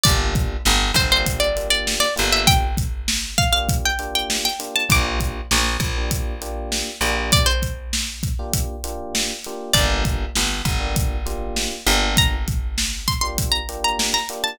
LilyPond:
<<
  \new Staff \with { instrumentName = "Pizzicato Strings" } { \time 4/4 \key g \dorian \tempo 4 = 99 d''8 r4 c''16 c''8 d''8 d''8 d''16 r16 e''16 | g''8 r4 f''16 f''8 g''8 g''8 g''16 r16 a''16 | d'''1 | d''16 c''4~ c''16 r2 r8 |
d''1 | bes''8 r4 c'''16 c'''8 bes''8 bes''8 bes''16 r16 a''16 | }
  \new Staff \with { instrumentName = "Electric Piano 1" } { \time 4/4 \key g \dorian <bes d' f' g'>4.~ <bes d' f' g'>16 <bes d' f' g'>8. <bes d' f' g'>4 <bes d' f' g'>8~ | <bes d' f' g'>4.~ <bes d' f' g'>16 <bes d' f' g'>8. <bes d' f' g'>4 <bes d' f' g'>8 | <bes d' f' g'>4.~ <bes d' f' g'>16 <bes d' f' g'>8. <bes d' f' g'>4 <bes d' f' g'>8~ | <bes d' f' g'>4.~ <bes d' f' g'>16 <bes d' f' g'>8. <bes d' f' g'>4 <bes d' f' g'>8 |
<bes d' f' g'>4.~ <bes d' f' g'>16 <bes d' f' g'>8. <bes d' f' g'>4 <bes d' f' g'>8~ | <bes d' f' g'>4.~ <bes d' f' g'>16 <bes d' f' g'>8. <bes d' f' g'>4 <bes d' f' g'>8 | }
  \new Staff \with { instrumentName = "Electric Bass (finger)" } { \clef bass \time 4/4 \key g \dorian g,,4 g,,8 g,,2 g,,8~ | g,,1 | bes,,4 bes,,8 bes,,2 bes,,8~ | bes,,1 |
g,,4 g,,8 g,,2 g,,8~ | g,,1 | }
  \new DrumStaff \with { instrumentName = "Drums" } \drummode { \time 4/4 <hh bd>8 <hh bd>8 sn8 <hh bd>8 <hh bd>8 hh8 sn8 hh8 | <hh bd>8 <hh bd>8 sn8 <hh bd>8 <hh bd>8 hh8 sn8 hh8 | <hh bd>8 <hh bd>8 sn8 <hh bd>8 <hh bd>8 hh8 sn8 hh8 | <hh bd>8 <hh bd>8 sn8 <hh bd>8 <hh bd>8 hh8 sn8 hh8 |
<hh bd>8 <hh bd>8 sn8 <hh bd sn>8 <hh bd>8 hh8 sn8 hh8 | <hh bd>8 <hh bd>8 sn8 <hh bd>8 <hh bd>8 hh8 sn8 hh8 | }
>>